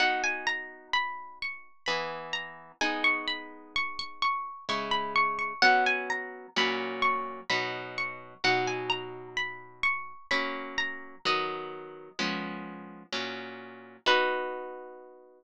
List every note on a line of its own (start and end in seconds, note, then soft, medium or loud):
0.00 1.69 B3 medium
0.00 1.69 D#4 medium
0.00 1.69 F#4 medium
0.00 0.22 F#5 loud
0.24 0.46 G#5 loud
0.47 0.88 A#5 loud
0.93 1.39 B5 medium
1.42 1.84 C#6 medium
1.86 2.72 E3 medium
1.86 2.72 B3 medium
1.86 2.72 G#4 loud
1.86 2.25 B5 medium
2.33 2.71 A#5 medium
2.81 4.50 G#3 medium
2.81 4.50 B3 medium
2.81 4.50 D#4 medium
2.81 3.03 G#5 loud
3.04 3.26 C#6 loud
3.28 3.73 B5 medium
3.76 3.98 C#6 loud
3.99 4.21 C#6 loud
4.22 4.65 C#6 loud
4.69 5.53 C#3 medium
4.69 5.53 G#3 medium
4.69 5.53 E4 medium
4.69 4.92 C#6 loud
4.91 5.13 B5 medium
5.16 5.38 C#6 loud
5.39 5.61 C#6 medium
5.62 6.47 F#3 medium
5.62 6.47 B3 medium
5.62 6.47 C#4 medium
5.62 5.84 F#5 loud
5.86 6.09 G#5 loud
6.10 6.48 A#5 loud
6.56 7.41 A#2 medium
6.56 7.41 F#3 loud
6.56 7.41 C#4 medium
6.56 7.02 B5 loud
7.02 7.41 C#6 loud
7.50 8.34 B2 medium
7.50 8.34 F#3 medium
7.50 8.34 D#4 medium
7.50 7.95 B5 medium
7.98 8.42 C#6 medium
8.44 10.13 B2 medium
8.44 10.13 F#3 medium
8.44 10.13 D#4 medium
8.44 8.67 F#5 medium
8.67 8.90 G#5 medium
8.90 9.27 A#5 medium
9.37 9.81 B5 medium
9.83 10.27 C#6 loud
10.31 11.16 F#3 medium
10.31 11.16 A#3 medium
10.31 11.16 C#4 medium
10.31 10.75 B5 loud
10.78 11.19 A#5 loud
11.25 12.10 D#3 medium
11.25 12.10 F#3 medium
11.25 12.10 B3 medium
11.25 12.50 D#5 loud
12.19 13.03 F3 medium
12.19 13.03 G#3 medium
12.19 13.03 B3 medium
12.19 13.03 C#4 medium
13.12 13.97 A#2 medium
13.12 13.97 F#3 medium
13.12 13.97 C#4 medium
14.06 15.44 B3 loud
14.06 15.44 D#4 loud
14.06 15.44 F#4 loud
14.06 15.44 B4 loud